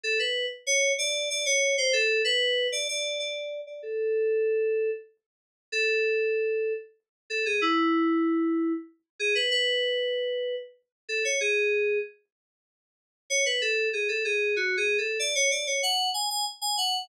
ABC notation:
X:1
M:3/4
L:1/16
Q:1/4=95
K:A
V:1 name="Electric Piano 2"
A B2 z c2 d2 d c2 =c | A2 B3 d d2 d3 d | A8 z4 | [K:F#m] A8 z2 A G |
E8 z2 G B | B8 z2 A c | G4 z8 | [K:A] c B A2 G A G2 (3F2 G2 A2 |
d c d c f2 g g z g f2 |]